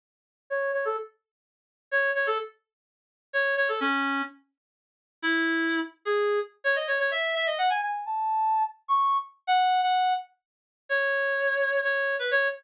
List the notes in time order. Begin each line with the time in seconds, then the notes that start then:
0.50 C#5
0.73 C#5
0.85 A4
1.91 C#5
2.15 C#5
2.27 A4
3.33 C#5
3.57 C#5
3.69 A4
3.80 C#4
5.22 E4
6.05 G#4
6.64 C#5
6.76 D#5
6.87 C#5
6.99 C#5
7.11 E5
7.35 E5
7.47 D#5
7.58 F#5
7.70 G#5
7.82 G#5
8.06 A5
8.88 C#6
9.47 F#5
9.83 F#5
10.89 C#5
11.83 C#5
12.19 B4
12.31 C#5